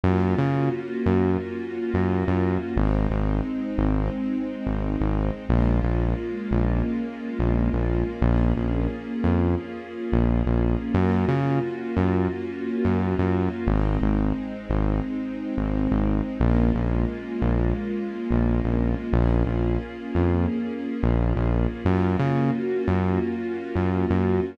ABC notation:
X:1
M:4/4
L:1/16
Q:"Swing 16ths" 1/4=88
K:Bbm
V:1 name="String Ensemble 1"
[B,DFG]16 | [A,CE]16 | [A,B,DF]16 | [B,DFA]16 |
[B,DFG]16 | [A,CE]16 | [A,B,DF]16 | [B,DFA]16 |
[B,DFG]16 |]
V:2 name="Synth Bass 1" clef=bass
G,,2 D,4 G,,5 G,,2 G,,3 | A,,,2 A,,,4 A,,,5 A,,,2 A,,,3 | B,,,2 B,,,4 B,,,5 B,,,2 B,,,3 | B,,,2 B,,,4 F,,5 B,,,2 B,,,3 |
G,,2 D,4 G,,5 G,,2 G,,3 | A,,,2 A,,,4 A,,,5 A,,,2 A,,,3 | B,,,2 B,,,4 B,,,5 B,,,2 B,,,3 | B,,,2 B,,,4 F,,5 B,,,2 B,,,3 |
G,,2 D,4 G,,5 G,,2 G,,3 |]